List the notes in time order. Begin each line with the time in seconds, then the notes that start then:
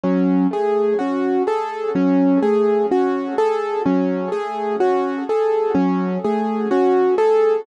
0.03 F#3 C#4
0.51 A3 G#4
0.99 C#4 F#4
1.47 G#4 A4
1.95 F#3 C#4
2.42 A3 G#4
2.91 C#4 F#4
3.38 G#4 A4
3.86 F#3 C#4
4.32 A3 G#4
4.80 C#4 F#4
5.29 G#4 A4
5.75 F#3 C#4
6.24 A3 G#4
6.71 C#4 F#4
7.18 G#4 A4